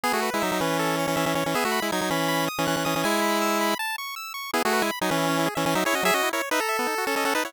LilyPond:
<<
  \new Staff \with { instrumentName = "Lead 1 (square)" } { \time 4/4 \key e \major \tempo 4 = 160 <b gis'>16 <a fis'>8 <gis e'>16 <fis dis'>16 <fis dis'>16 <e cis'>4~ <e cis'>16 <e cis'>16 <e cis'>16 <e cis'>16 <e cis'>16 <e cis'>16 | <b gis'>16 <a fis'>8 <gis e'>16 <fis dis'>16 <fis dis'>16 <e cis'>4~ <e cis'>16 <e cis'>16 <e cis'>16 <e cis'>16 <e cis'>16 <e cis'>16 | <gis e'>2 r2 | <b gis'>16 <a fis'>8 <gis e'>16 r16 <fis dis'>16 <e cis'>4~ <e cis'>16 <e cis'>16 <e cis'>16 <fis dis'>16 <e' cis''>16 <fis' dis''>16 |
<gis' e''>16 <fis' dis''>8 <e' cis''>16 r16 <dis' b'>16 a'4~ a'16 <cis' a'>16 <cis' a'>16 <cis' a'>16 <dis' b'>16 <e' cis''>16 | }
  \new Staff \with { instrumentName = "Lead 1 (square)" } { \time 4/4 \key e \major gis'8 b'8 e''8 b'8 a'8 cis''8 e''8 cis''8 | e''8 b''8 gis'''8 b''8 b''8 dis'''8 fis'''8 dis'''8 | gis''8 b''8 e'''8 b''8 a''8 cis'''8 e'''8 cis'''8 | e'16 gis'16 b'16 gis''16 b''16 gis''16 b'16 e'16 cis'16 e'16 gis'16 e''16 gis''16 e''16 gis'16 cis'16 |
fis16 cis'16 e'16 ais'16 cis''16 e''16 ais''16 e''16 b16 dis'16 fis'16 a'16 dis''16 fis''16 a''16 fis''16 | }
>>